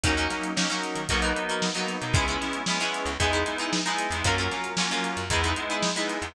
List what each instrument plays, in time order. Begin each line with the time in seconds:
0.04 electric bass (finger) D#2, electric piano 2 F#3 A#3 C#4 D#4, acoustic guitar (steel) C#4 D#4 F#4 A#4, kick, closed hi-hat
0.17 acoustic guitar (steel) C#4 D#4 F#4 A#4, closed hi-hat
0.30 electric piano 2 F#3 A#3 C#4 D#4, snare, closed hi-hat
0.43 closed hi-hat
0.56 electric piano 2 F#3 A#3 C#4 D#4, acoustic guitar (steel) C#4 D#4 F#4 A#4, snare
0.70 electric piano 2 F#3 A#3 C#4 D#4, acoustic guitar (steel) C#4 D#4 F#4 A#4, snare, closed hi-hat
0.83 snare, closed hi-hat
0.95 electric bass (finger) D#3, closed hi-hat
1.09 electric bass (finger) B1, electric piano 2 F#3 A#3 B3 D#4, acoustic guitar (steel) D#4 F#4 A#4 B4, kick, closed hi-hat
1.22 acoustic guitar (steel) D#4 F#4 A#4 B4, closed hi-hat
1.36 electric piano 2 F#3 A#3 B3 D#4, closed hi-hat
1.49 acoustic guitar (steel) D#4 F#4 A#4 B4, closed hi-hat
1.62 snare
1.75 electric piano 2 F#3 A#3 B3 D#4, acoustic guitar (steel) D#4 F#4 A#4 B4, closed hi-hat
1.87 snare, closed hi-hat
2.01 electric bass (finger) B2, electric piano 2 F#3 A#3 B3 D#4, closed hi-hat
2.13 electric bass (finger) C#2, electric piano 2 G#3 B3 C#4 E4, acoustic guitar (steel) C#4 E4 G#4 B4, kick, closed hi-hat
2.28 acoustic guitar (steel) C#4 E4 G#4 B4, closed hi-hat
2.41 electric piano 2 G#3 B3 C#4 E4, snare, closed hi-hat
2.53 closed hi-hat
2.66 electric piano 2 G#3 B3 C#4 E4, acoustic guitar (steel) C#4 E4 G#4 B4, snare
2.80 electric piano 2 G#3 B3 C#4 E4, acoustic guitar (steel) C#4 E4 G#4 B4, closed hi-hat
2.93 snare, closed hi-hat
3.05 electric bass (finger) C#2, closed hi-hat
3.20 electric bass (finger) E2, electric piano 2 G#3 B3 D#4 E4, acoustic guitar (steel) D#4 E4 G#4 B4, kick, closed hi-hat
3.33 acoustic guitar (steel) D#4 E4 G#4 B4, closed hi-hat
3.46 electric piano 2 G#3 B3 D#4 E4, snare, closed hi-hat
3.58 acoustic guitar (steel) D#4 E4 G#4 B4, closed hi-hat
3.73 snare
3.86 electric piano 2 G#3 B3 D#4 E4, acoustic guitar (steel) D#4 E4 G#4 B4, snare, closed hi-hat
3.98 closed hi-hat
4.11 electric bass (finger) E2, electric piano 2 G#3 B3 D#4 E4, closed hi-hat
4.24 electric bass (finger) F#2, electric piano 2 F#3 A#3 C#4 F4, acoustic guitar (steel) C#4 F4 F#4 A#4, kick, closed hi-hat
4.38 acoustic guitar (steel) C#4 F4 F#4 A#4, closed hi-hat
4.51 electric piano 2 F#3 A#3 C#4 F4, snare, closed hi-hat
4.64 closed hi-hat
4.77 electric piano 2 F#3 A#3 C#4 F4, acoustic guitar (steel) C#4 F4 F#4 A#4, snare
4.91 electric piano 2 F#3 A#3 C#4 F4, acoustic guitar (steel) C#4 F4 F#4 A#4, snare, closed hi-hat
5.04 closed hi-hat
5.17 electric bass (finger) F#2, closed hi-hat
5.30 electric bass (finger) E2, electric piano 2 G#3 B3 D#4 E4, acoustic guitar (steel) D#4 E4 G#4 B4, kick, closed hi-hat
5.44 acoustic guitar (steel) D#4 E4 G#4 B4, snare, closed hi-hat
5.56 electric piano 2 G#3 B3 D#4 E4, closed hi-hat
5.70 acoustic guitar (steel) D#4 E4 G#4 B4, closed hi-hat
5.83 snare
5.96 electric piano 2 G#3 B3 D#4 E4, acoustic guitar (steel) D#4 E4 G#4 B4, closed hi-hat
6.08 snare, closed hi-hat
6.22 electric bass (finger) E2, electric piano 2 G#3 B3 D#4 E4, closed hi-hat